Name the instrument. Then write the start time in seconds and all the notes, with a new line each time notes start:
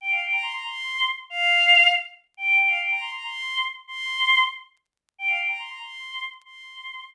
choir aahs
0.01 G5
0.10 F5
0.22 G5
0.32 A#5
0.42 C6
0.53 A#5
0.66 C6
1.30 F5
2.37 G5
2.59 G5
2.68 F5
2.80 G5
2.91 A#5
3.00 C6
3.13 A#5
3.24 C6
3.87 C6
5.18 G5
5.28 F5
5.37 G5
5.48 A#5
5.59 C6
5.69 A#5
5.82 C6
6.45 C6